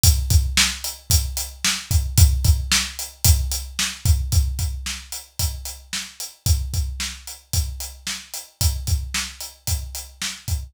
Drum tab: HH |xx-xxx-x|xx-xxx-x|xx-xxx-x|xx-xxx-x|
SD |--o---o-|--o---o-|--o---o-|--o---o-|
BD |oo--o--o|oo--o--o|oo--o---|oo--o---|

HH |xx-xxx-x|
SD |--o---o-|
BD |oo--o--o|